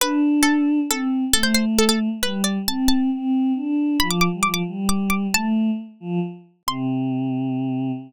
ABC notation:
X:1
M:6/8
L:1/16
Q:3/8=90
K:C
V:1 name="Pizzicato Strings"
B4 A4 A4 | A c c z A A z2 B2 d2 | a2 a4 z6 | b d' d' z d' d' z2 d'2 d'2 |
a4 z8 | c'12 |]
V:2 name="Choir Aahs"
D8 C4 | A,8 G,4 | C4 C4 D4 | F,3 G, F,2 G,6 |
A,4 z2 F,2 z4 | C,12 |]